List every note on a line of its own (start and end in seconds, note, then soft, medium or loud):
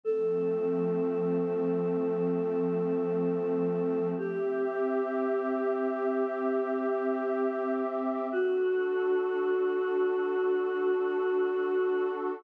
0.04 4.13 F3 medium
0.04 4.13 A3 medium
0.04 4.13 C4 medium
0.04 4.08 A4 medium
4.17 8.27 C4 medium
4.17 8.27 G4 medium
4.17 7.73 G4 medium
4.17 8.27 E5 medium
8.31 12.41 D4 medium
8.31 12.41 F#4 medium
8.31 12.08 F#4 medium
8.31 12.41 A4 medium